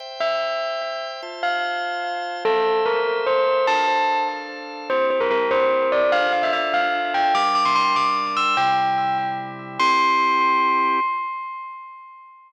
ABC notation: X:1
M:6/8
L:1/16
Q:3/8=98
K:Cmix
V:1 name="Tubular Bells"
z2 e10 | z2 f10 | A4 B4 c4 | a6 z6 |
c2 c B B2 c4 d2 | f2 f e e2 f4 g2 | d'2 d' c' c'2 d'4 e'2 | g8 z4 |
c'12 |]
V:2 name="Drawbar Organ"
[ceg]12 | [Fca]12 | [Ace]12 | [DAf]12 |
[CEG]12 | [DFA]12 | [G,DB]12 | [C,G,E]12 |
[CEG]12 |]